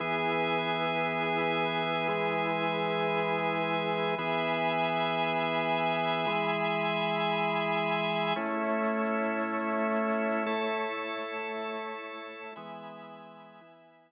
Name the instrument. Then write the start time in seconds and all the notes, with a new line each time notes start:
drawbar organ
0.00 E3 B3 E4 G#4 B4
2.08 E3 G#3 G#4
4.18 E3 B3 G#4 E5 G#5 B5
6.27 E3 G#3 G#4
8.36 A3 C#4 E4 C#5
10.46 A3 E4 A4
12.56 E3 G#3 B3 E5 G#5 B5
13.61 E3 B3 E4